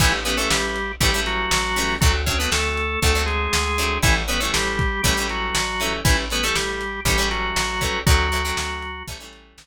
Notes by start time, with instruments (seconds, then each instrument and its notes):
0.00 electric bass (finger) A1, drawbar organ E3 E4, acoustic guitar (steel) E3 G3 A3 C#4, kick, crash
0.25 acoustic guitar (steel) E3 G3 A3 C#4, drawbar organ B3 B4, closed hi-hat
0.37 acoustic guitar (steel) E3 G3 A3 C#4, drawbar organ A3 A4
0.50 electric bass (finger) A1, drawbar organ G3 G4, snare
0.76 closed hi-hat
1.00 electric bass (finger) A1, acoustic guitar (steel) E3 G3 A3 C#4, drawbar organ G3 G4, kick, closed hi-hat
1.14 acoustic guitar (steel) E3 G3 A3 C#4
1.26 drawbar organ F#3 F#4, closed hi-hat
1.51 electric bass (finger) A1, snare
1.76 acoustic guitar (steel) E3 G3 A3 C#4, open hi-hat
2.01 electric bass (finger) D2, drawbar organ F#3 F#4, acoustic guitar (steel) F#3 A3 C4 D4, kick, closed hi-hat
2.26 acoustic guitar (steel) F#3 A3 C4 D4, drawbar organ C#4 C#5, kick, closed hi-hat
2.39 acoustic guitar (steel) F#3 A3 C4 D4, drawbar organ B3 B4
2.52 electric bass (finger) D2, drawbar organ A3 A4, snare
2.77 closed hi-hat
3.02 electric bass (finger) D2, acoustic guitar (steel) F#3 A3 C4 D4, drawbar organ A3 A4, kick, closed hi-hat
3.15 acoustic guitar (steel) F#3 A3 C4 D4
3.26 drawbar organ G#3 G#4, closed hi-hat
3.53 electric bass (finger) D2, snare
3.78 acoustic guitar (steel) F#3 A3 C4 D4, closed hi-hat
4.03 electric bass (finger) A1, drawbar organ E3 E4, acoustic guitar (steel) E3 G3 A3 C#4, kick, closed hi-hat
4.28 acoustic guitar (steel) E3 G3 A3 C#4, drawbar organ B3 B4, closed hi-hat
4.40 acoustic guitar (steel) E3 G3 A3 C#4, drawbar organ A3 A4
4.54 electric bass (finger) A1, drawbar organ G3 G4, snare
4.79 kick, closed hi-hat
5.03 electric bass (finger) A1, acoustic guitar (steel) E3 G3 A3 C#4, drawbar organ G3 G4, kick, closed hi-hat
5.17 acoustic guitar (steel) E3 G3 A3 C#4
5.29 drawbar organ F#3 F#4, closed hi-hat
5.55 electric bass (finger) A1, snare
5.80 acoustic guitar (steel) E3 G3 A3 C#4, closed hi-hat
6.05 electric bass (finger) A1, drawbar organ E3 E4, acoustic guitar (steel) E3 G3 A3 C#4, kick, closed hi-hat
6.30 acoustic guitar (steel) E3 G3 A3 C#4, drawbar organ B3 B4, closed hi-hat
6.43 acoustic guitar (steel) E3 G3 A3 C#4, drawbar organ A3 A4
6.55 electric bass (finger) A1, drawbar organ G3 G4, snare
6.81 closed hi-hat
7.05 electric bass (finger) A1, acoustic guitar (steel) E3 G3 A3 C#4, drawbar organ G3 G4, kick, closed hi-hat
7.18 acoustic guitar (steel) E3 G3 A3 C#4
7.31 drawbar organ F#3 F#4, closed hi-hat
7.56 electric bass (finger) A1, snare
7.81 acoustic guitar (steel) E3 G3 A3 C#4, kick, closed hi-hat
8.06 electric bass (finger) D2, drawbar organ F#3 F#4, acoustic guitar (steel) F#3 A3 C4 D4, kick, closed hi-hat
8.32 acoustic guitar (steel) F#3 A3 C4 D4, closed hi-hat
8.45 acoustic guitar (steel) F#3 A3 C4 D4
8.57 electric bass (finger) D2, snare
8.82 closed hi-hat
9.07 electric bass (finger) A1, acoustic guitar (steel) E3 G3 A3 C#4, kick, closed hi-hat
9.20 acoustic guitar (steel) E3 G3 A3 C#4
9.33 closed hi-hat
9.58 electric bass (finger) A1, snare